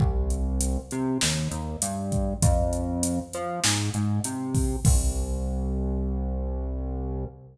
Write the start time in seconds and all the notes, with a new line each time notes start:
0.00 C2, kick
0.30 closed hi-hat
0.61 closed hi-hat
0.91 C3, closed hi-hat
1.21 D#2, snare
1.51 D#2, closed hi-hat
1.82 G2, closed hi-hat
2.12 kick, closed hi-hat
2.42 F2, kick, closed hi-hat
2.73 closed hi-hat
3.03 closed hi-hat
3.33 F3, closed hi-hat
3.64 G#2, snare
3.94 G#2, closed hi-hat
4.24 C3, closed hi-hat
4.55 kick, open hi-hat
4.85 C2, kick, crash